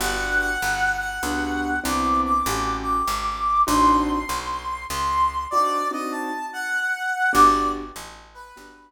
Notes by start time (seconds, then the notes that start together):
0.00 G1 B3 D4 F#4 G4 F#5
0.39 F#5
0.62 G1
0.99 F#5
1.23 C#2 B3 D4 F#4 G4
1.84 C2 B3 C4 D4 E4 D6
2.25 D6
2.46 A1 A3 C#4 F#4 G4
2.83 D6
3.08 G#1
3.67 A1 C4 D4 D#4 F#4 C6
4.29 B1
4.90 C#2 C6
5.51 C4 D4 D#4 F#4 D5
5.91 C4 D4 D#4 F#4 D#5
6.12 A5
6.53 F#5
7.33 G1 B3 D4 F#4 G4 D5
7.96 A1
8.34 B4
8.56 G1 B3 D4 F#4 G4